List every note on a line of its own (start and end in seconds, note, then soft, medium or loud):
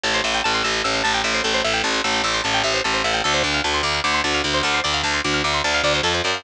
0.04 0.21 A1 loud
0.04 0.13 A4 medium
0.14 0.23 C5 medium
0.24 0.41 A1 medium
0.24 0.33 E5 medium
0.34 0.43 G5 medium
0.44 0.62 A1 medium
0.44 0.53 A5 medium
0.54 0.63 C6 medium
0.64 0.82 A1 medium
0.64 0.73 E6 medium
0.74 0.83 G6 medium
0.84 1.02 A1 medium
0.84 0.93 E6 medium
0.94 1.03 C6 medium
1.04 1.22 A1 medium
1.04 1.13 A5 medium
1.14 1.23 G5 medium
1.24 1.41 A1 medium
1.24 1.33 E5 medium
1.34 1.43 C5 medium
1.44 1.61 A1 medium
1.44 1.53 A4 medium
1.54 1.63 C5 medium
1.64 1.81 A1 medium
1.64 1.73 E5 medium
1.74 1.83 G5 medium
1.84 2.01 A1 medium
1.84 1.93 A5 medium
1.94 2.03 C6 medium
2.04 2.21 A1 loud
2.04 2.13 E6 medium
2.14 2.23 G6 medium
2.24 2.41 A1 loud
2.24 2.33 E6 medium
2.34 2.43 C6 medium
2.44 2.62 A1 medium
2.44 2.53 A5 medium
2.54 2.63 G5 medium
2.64 2.81 A1 medium
2.64 2.73 E5 medium
2.74 2.83 C5 medium
2.84 3.02 A1 medium
2.84 2.93 A4 medium
2.94 3.03 C5 medium
3.04 3.21 A1 medium
3.04 3.13 E5 medium
3.14 3.23 G5 medium
3.24 3.42 D2 loud
3.24 3.33 A4 medium
3.34 3.43 C5 medium
3.44 3.61 D2 medium
3.44 3.53 D5 medium
3.54 3.63 F5 medium
3.64 3.81 D2 medium
3.64 3.73 A5 medium
3.74 3.83 C6 medium
3.83 4.00 D2 medium
3.83 3.93 D6 medium
3.94 4.03 F6 medium
4.04 4.21 D2 medium
4.04 4.13 D6 medium
4.14 4.23 C6 medium
4.24 4.41 D2 loud
4.24 4.33 A5 medium
4.34 4.43 F5 medium
4.44 4.61 D2 medium
4.44 4.53 D5 medium
4.54 4.63 C5 medium
4.63 4.80 D2 medium
4.63 4.73 A4 medium
4.74 4.83 C5 medium
4.84 5.02 D2 medium
4.84 4.93 D5 medium
4.94 5.03 F5 medium
5.03 5.20 D2 medium
5.03 5.13 A5 medium
5.14 5.23 C6 medium
5.24 5.42 D2 loud
5.24 5.33 D6 medium
5.34 5.43 F6 medium
5.44 5.61 D2 medium
5.44 5.53 D6 medium
5.54 5.63 C6 medium
5.64 5.81 D2 medium
5.64 5.73 A5 medium
5.74 5.83 F5 medium
5.84 6.01 D2 medium
5.84 5.93 D5 medium
5.94 6.03 C5 medium
6.03 6.21 F2 medium
6.03 6.13 A4 medium
6.14 6.23 C5 medium
6.24 6.43 F#2 medium
6.24 6.33 D5 medium
6.34 6.43 F5 medium